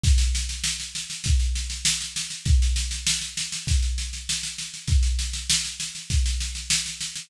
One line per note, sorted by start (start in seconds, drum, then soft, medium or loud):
0.04 kick loud
0.04 snare loud
0.18 snare loud
0.35 snare loud
0.49 snare medium
0.64 snare loud
0.80 snare medium
0.95 snare medium
1.10 snare medium
1.24 kick loud
1.24 snare loud
1.40 snare medium
1.55 snare medium
1.70 snare medium
1.85 snare loud
2.01 snare medium
2.16 snare loud
2.30 snare medium
2.45 kick loud
2.45 snare medium
2.62 snare medium
2.76 snare loud
2.91 snare medium
3.07 snare loud
3.21 snare medium
3.37 snare loud
3.52 snare medium
3.67 kick loud
3.67 snare loud
3.82 snare medium
3.98 snare medium
4.13 snare medium
4.29 snare loud
4.43 snare medium
4.58 snare medium
4.74 snare medium
4.88 kick loud
4.88 snare medium
5.03 snare medium
5.19 snare medium
5.33 snare medium
5.50 snare loud
5.65 snare medium
5.80 snare loud
5.95 snare medium
6.10 kick loud
6.10 snare medium
6.26 snare medium
6.41 snare medium
6.55 snare medium
6.70 snare loud
6.86 snare medium
7.01 snare loud
7.16 snare medium